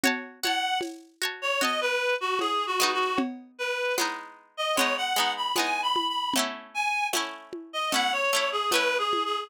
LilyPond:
<<
  \new Staff \with { instrumentName = "Clarinet" } { \time 4/4 \key b \mixolydian \tempo 4 = 76 r8 fis''8 r8. cis''16 dis''16 b'8 fis'16 \tuplet 3/2 { gis'8 fis'8 fis'8 } | r8 b'8 r8. dis''16 cis''16 fis''8 b''16 \tuplet 3/2 { gis''8 b''8 b''8 } | r8 gis''8 r8. dis''16 fis''16 cis''8 gis'16 \tuplet 3/2 { b'8 gis'8 gis'8 } | }
  \new Staff \with { instrumentName = "Pizzicato Strings" } { \time 4/4 \key b \mixolydian <fis' cis'' a''>8 <fis' cis'' a''>4 <fis' cis'' a''>8 <fis' cis'' a''>4. <gis b dis'>8~ | <gis b dis'>4 <gis b dis'>4 <gis b dis'>8 <gis b dis'>8 <gis b dis'>4 | <a cis' e'>4 <a cis' e'>4 <a cis' e'>8 <a cis' e'>8 <a cis' e'>4 | }
  \new DrumStaff \with { instrumentName = "Drums" } \drummode { \time 4/4 <cgl cb>8 cgho8 <cgho cb tamb>4 <cgl cb>4 <cgho cb tamb>4 | <cgl cb>4 <cgho cb tamb>4 <cgl cb>4 <cgho cb tamb>8 cgho8 | <cgl cb>4 <cgho cb tamb>8 cgho8 <cgl cb>4 <cgho cb tamb>8 cgho8 | }
>>